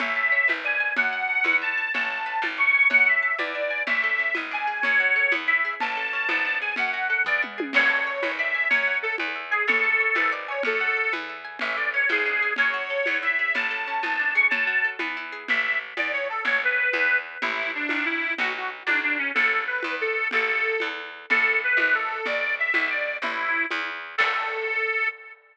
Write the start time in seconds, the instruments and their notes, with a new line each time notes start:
0.00 electric bass (finger) A1, pizzicato strings C#5, accordion E5, low conga
0.16 pizzicato strings A5
0.32 pizzicato strings C#5
0.48 electric bass (finger) G#1, pizzicato strings B4, high conga
0.65 pizzicato strings D5, accordion G#5
0.80 pizzicato strings G#5
0.97 electric bass (finger) F#2, pizzicato strings C#5, accordion F#5, low conga
1.13 pizzicato strings F#5
1.30 pizzicato strings A5
1.44 electric bass (finger) E2, pizzicato strings B4, high conga
1.62 pizzicato strings E5, accordion A5
1.78 pizzicato strings G#5
1.94 electric bass (finger) A1, pizzicato strings C#5, accordion A5, low conga
2.10 pizzicato strings A5
2.26 pizzicato strings B4
2.42 electric bass (finger) G#1, high conga
2.57 pizzicato strings D5, accordion C#6
2.74 pizzicato strings G#5
2.90 electric bass (finger) F#2, pizzicato strings C#5, accordion F#5, low conga
3.07 accordion E5, pizzicato strings F#5
3.23 pizzicato strings A5
3.38 electric bass (finger) E2, pizzicato strings B4, accordion D5, high conga
3.55 pizzicato strings E5
3.71 pizzicato strings G#5
3.87 electric bass (finger) A1, pizzicato strings C#4, accordion E5, low conga
4.04 pizzicato strings A4
4.19 pizzicato strings C#4
4.35 electric bass (finger) G#1, pizzicato strings B3, high conga
4.51 pizzicato strings D4, accordion G#5
4.67 pizzicato strings G#4
4.82 electric bass (finger) F#2, pizzicato strings C#4, accordion C#5, low conga
5.00 pizzicato strings F#4
5.16 pizzicato strings A4
5.32 electric bass (finger) E2, pizzicato strings B3, high conga
5.48 pizzicato strings E4, accordion E5
5.65 pizzicato strings G#4
5.80 electric bass (finger) A1, pizzicato strings C#4, accordion A5, low conga
5.97 pizzicato strings A4
6.13 pizzicato strings C#4
6.29 electric bass (finger) G#1, pizzicato strings B3, high conga
6.45 pizzicato strings D4
6.61 pizzicato strings G#4, accordion G#5
6.76 electric bass (finger) F#2, pizzicato strings C#4, accordion F#5, low conga
6.92 pizzicato strings F#4, accordion F#5
7.09 pizzicato strings A4, accordion F#5
7.25 electric bass (finger) E2, pizzicato strings B3, accordion D5, kick, floor tom
7.42 pizzicato strings E4, mid tom
7.58 pizzicato strings G#4, high tom
7.73 electric bass (finger) A1, pizzicato strings C#5, accordion C#5, crash, low conga
7.90 pizzicato strings A5
8.07 pizzicato strings C#5
8.23 electric bass (finger) G#1, pizzicato strings B4, high conga
8.39 pizzicato strings D5, accordion E5
8.55 pizzicato strings G#5
8.69 electric bass (finger) F#2, accordion C#5, pizzicato strings C#5, low conga
8.87 pizzicato strings F#5
9.02 accordion A4, pizzicato strings A5
9.18 electric bass (finger) E2, pizzicato strings B4, high conga
9.36 pizzicato strings E5
9.51 accordion G#4, pizzicato strings G#5
9.67 electric bass (finger) A1, accordion A4, pizzicato strings C#5, low conga
9.84 pizzicato strings A5
10.00 pizzicato strings C#5
10.15 electric bass (finger) G#1, pizzicato strings B4, high conga
10.32 pizzicato strings D5
10.48 accordion C#5, pizzicato strings G#5
10.63 electric bass (finger) F#2, accordion A4, pizzicato strings C#5, low conga
10.81 pizzicato strings F#5
10.97 pizzicato strings A5
11.13 electric bass (finger) E2, pizzicato strings B4, high conga
11.29 pizzicato strings E5
11.45 pizzicato strings G#5
11.59 electric bass (finger) A1, pizzicato strings C#4, accordion E5, low conga
11.76 pizzicato strings A4, accordion D5
11.94 pizzicato strings C#4, accordion C#5
12.09 electric bass (finger) G#1, pizzicato strings B3, accordion G#4, high conga
12.26 pizzicato strings D4
12.42 pizzicato strings G#4
12.56 electric bass (finger) F#2, pizzicato strings C#4, accordion C#5, low conga
12.74 pizzicato strings F#4
12.90 pizzicato strings A4
13.06 electric bass (finger) E2, pizzicato strings B3, high conga
13.23 pizzicato strings E4, accordion E5
13.39 pizzicato strings G#4
13.55 electric bass (finger) A1, pizzicato strings C#4, accordion A5, low conga
13.71 pizzicato strings A4
13.87 pizzicato strings C#4
14.03 electric bass (finger) G#1, pizzicato strings B3, high conga
14.19 pizzicato strings D4
14.35 pizzicato strings G#4, accordion C#6
14.50 electric bass (finger) F#2, pizzicato strings C#4, accordion A5, low conga
14.67 pizzicato strings F#4
14.84 pizzicato strings A4
14.99 electric bass (finger) E2, pizzicato strings B3, high conga
15.17 pizzicato strings E4
15.32 pizzicato strings G#4
15.48 electric bass (finger) A1, accordion E5, low conga
15.63 accordion E5
15.97 electric bass (finger) E2, accordion D5, high conga
16.13 accordion C#5
16.29 accordion A4
16.45 electric bass (finger) A1, accordion C#5, low conga
16.64 accordion B4
16.93 electric bass (finger) E2, high conga
17.42 electric bass (finger) A1, accordion E4, low conga
17.75 accordion D4
17.89 electric bass (finger) G#1, high conga
18.05 accordion E4
18.38 electric bass (finger) B1, accordion F#4, low conga
18.56 accordion F#4
18.86 electric bass (finger) B1, accordion D4, high conga
19.03 accordion D4
19.18 accordion C#4
19.35 electric bass (finger) A1, accordion A4, low conga
19.67 accordion B4
19.83 electric bass (finger) E2, high conga
20.01 accordion A4
20.31 electric bass (finger) A1, accordion A4, low conga
20.80 electric bass (finger) E2, high conga
21.30 electric bass (finger) A1, accordion A4, low conga
21.64 accordion B4
21.77 electric bass (finger) G#1, high conga
21.95 accordion A4
22.26 electric bass (finger) B1, accordion D5, low conga
22.59 accordion E5
22.74 electric bass (finger) B1, high conga
22.90 accordion D5
23.22 electric bass (finger) A1, accordion E4, low conga
23.71 electric bass (finger) E2, high conga
24.18 electric bass (finger) A2, accordion A4, kick, crash